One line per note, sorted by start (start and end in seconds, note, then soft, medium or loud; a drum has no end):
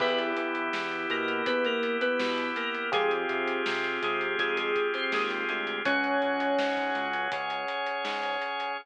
0.00 0.33 E2 loud
0.00 2.90 B3 medium
0.00 2.87 B3 medium
0.00 0.18 B3 loud
0.00 2.90 E4 medium
0.00 2.87 E4 medium
0.00 2.90 G4 medium
0.00 2.87 G4 medium
0.00 0.18 B4 loud
0.00 kick loud
0.00 crash loud
0.18 closed hi-hat medium
0.37 0.70 E3 medium
0.37 closed hi-hat loud
0.55 closed hi-hat medium
0.73 1.07 E2 medium
0.73 snare loud
0.91 closed hi-hat medium
1.10 1.43 B2 medium
1.10 1.44 A#3 medium
1.10 1.44 A#4 medium
1.10 closed hi-hat medium
1.28 closed hi-hat medium
1.46 1.80 E2 medium
1.46 1.64 B3 medium
1.46 1.64 B4 medium
1.46 kick loud
1.46 closed hi-hat loud
1.64 1.96 A#3 medium
1.64 1.96 A#4 medium
1.64 closed hi-hat medium
1.83 closed hi-hat loud
2.01 2.18 B3 medium
2.01 2.18 B4 medium
2.01 closed hi-hat loud
2.19 2.52 B2 medium
2.19 2.49 B3 medium
2.19 2.49 B4 medium
2.19 snare loud
2.38 closed hi-hat medium
2.56 2.90 A#3 medium
2.56 2.90 A#4 medium
2.56 closed hi-hat loud
2.75 closed hi-hat medium
2.92 3.26 F2 loud
2.92 3.10 G#3 medium
2.92 5.79 C4 medium
2.92 5.82 C4 medium
2.92 5.79 F4 medium
2.92 5.82 F4 medium
2.92 5.79 G4 medium
2.92 5.82 G4 medium
2.92 5.79 G#4 medium
2.92 5.82 G#4 medium
2.92 3.10 G#4 loud
2.92 kick loud
2.92 closed hi-hat loud
3.11 closed hi-hat medium
3.29 3.62 C3 medium
3.29 closed hi-hat medium
3.48 closed hi-hat medium
3.66 3.99 C3 medium
3.66 snare loud
3.84 closed hi-hat medium
4.02 4.35 C3 medium
4.02 4.38 G#3 medium
4.02 4.38 G#4 medium
4.02 closed hi-hat loud
4.21 closed hi-hat medium
4.39 4.72 F2 loud
4.39 4.56 G#3 medium
4.39 4.56 G#4 medium
4.39 kick loud
4.39 closed hi-hat loud
4.57 4.89 G#3 medium
4.57 4.89 G#4 medium
4.57 closed hi-hat loud
4.76 kick loud
4.76 closed hi-hat medium
4.94 5.12 C4 medium
4.94 5.12 C5 medium
4.94 closed hi-hat medium
5.12 5.45 D#2 medium
5.12 5.45 G#3 medium
5.12 5.45 G#4 medium
5.12 snare loud
5.30 closed hi-hat medium
5.49 5.82 D2 medium
5.49 5.79 G#3 medium
5.49 5.79 G#4 medium
5.49 closed hi-hat medium
5.67 closed hi-hat medium
5.85 6.18 C#2 loud
5.85 7.30 C#4 medium
5.85 7.08 C#4 medium
5.85 7.30 F#4 medium
5.85 7.30 G#4 medium
5.85 8.72 C#5 medium
5.85 7.08 C#5 loud
5.85 8.72 F#5 medium
5.85 8.72 G#5 medium
5.85 kick loud
5.85 closed hi-hat loud
6.04 closed hi-hat medium
6.22 6.55 C#2 loud
6.22 closed hi-hat medium
6.40 closed hi-hat loud
6.58 6.91 G#2 medium
6.58 snare loud
6.77 kick medium
6.77 closed hi-hat medium
6.95 7.28 C#2 loud
6.95 closed hi-hat medium
7.13 closed hi-hat medium
7.32 7.66 C#2 medium
7.32 8.77 C#4 medium
7.32 8.77 G#4 medium
7.32 8.77 C#5 medium
7.32 kick loud
7.32 closed hi-hat loud
7.50 closed hi-hat medium
7.68 closed hi-hat loud
7.86 closed hi-hat medium
8.04 8.37 G#2 medium
8.04 snare loud
8.23 closed hi-hat medium
8.42 closed hi-hat medium
8.60 closed hi-hat medium